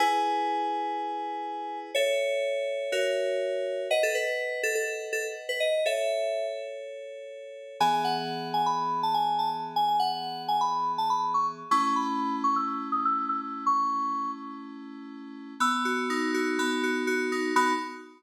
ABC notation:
X:1
M:4/4
L:1/16
Q:1/4=123
K:E
V:1 name="Electric Piano 2"
g16 | c16 | d A B4 A A3 A z2 B d2 | e6 z10 |
g g f4 g b3 a g2 a z2 | g g f4 g b3 a b2 c' z2 | c' c' b4 c' e'3 d' e'2 e' z2 | c'6 z10 |
[K:B] e'6 z10 | b4 z12 |]
V:2 name="Electric Piano 2"
[EGB]16 | [Ae]8 [F^Ace]8 | [Bdf]16 | [Ac]16 |
[E,B,G]16- | [E,B,G]16 | [A,CE]16- | [A,CE]16 |
[K:B] B,2 F2 D2 F2 B,2 F2 F2 D2 | [B,DF]4 z12 |]